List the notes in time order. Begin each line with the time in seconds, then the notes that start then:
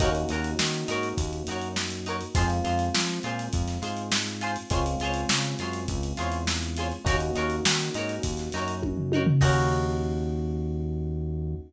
0.00 D#2 A#3 C#4 D#4 F#4 A#4 C#5, kick, closed hi-hat
0.15 closed hi-hat
0.29 D#2 D#4 F#4 A#4, closed hi-hat
0.34 C#5
0.44 closed hi-hat
0.59 D#3, snare
0.74 closed hi-hat
0.88 G#2 D#4 F#4 A#4 C#5, closed hi-hat
1.03 closed hi-hat
1.18 D#2, kick, closed hi-hat
1.33 closed hi-hat
1.47 F#2 D#4 F#4 A#4, closed hi-hat
1.51 C#5
1.62 closed hi-hat
1.76 snare
1.91 closed hi-hat
2.06 D#4 F#4 A#4 C#5, closed hi-hat
2.21 closed hi-hat
2.35 F2 G#3 C4 F4 G#4 C5, kick, closed hi-hat
2.50 closed hi-hat
2.64 F2 F4 G#4 C5, closed hi-hat
2.79 closed hi-hat
2.94 F3, snare
3.09 closed hi-hat
3.23 A#2 F4 G#4 C5, closed hi-hat
3.39 closed hi-hat
3.53 F2, kick, closed hi-hat
3.68 snare, closed hi-hat
3.82 G#2 F4 G#4 C5, closed hi-hat
3.97 closed hi-hat
4.12 snare
4.27 closed hi-hat
4.41 F4 G#4 C5, closed hi-hat
4.56 closed hi-hat
4.70 C#2 G#3 C4 C#4 F4 G#4 C5 C#5, kick, closed hi-hat
4.86 closed hi-hat
5.00 C#2 F4 G#4 C5, closed hi-hat
5.05 C#5
5.14 closed hi-hat
5.29 C#3, snare
5.44 closed hi-hat
5.59 F#2 F4 G#4 C5, snare, closed hi-hat
5.63 C#5
5.73 closed hi-hat
5.88 C#2, kick, closed hi-hat
6.03 closed hi-hat
6.17 E2 F4 G#4 C5 C#5, snare, closed hi-hat
6.32 closed hi-hat
6.47 snare
6.63 closed hi-hat
6.77 F4 G#4 C5, closed hi-hat
6.81 C#5
6.92 closed hi-hat
7.05 D#2 A#3 C#4 D#4 F#4 A#4, kick, closed hi-hat
7.09 C#5
7.20 closed hi-hat
7.35 D#2 D#4 F#4 A#4 C#5, closed hi-hat
7.50 closed hi-hat
7.65 D#3, snare
7.79 snare, closed hi-hat
7.94 G#2 D#4 F#4 A#4, closed hi-hat
7.99 C#5
8.09 closed hi-hat
8.23 D#2, kick, closed hi-hat
8.37 snare, closed hi-hat
8.52 F#2 D#4 F#4 A#4, snare, closed hi-hat
8.57 C#5
8.68 closed hi-hat
8.82 kick, high tom
8.97 floor tom
9.12 D#4 F#4 A#4, high tom
9.16 C#5
9.26 floor tom
9.41 D#2 A#3 C#4 D#4 F#4 A#4 C#5, kick, crash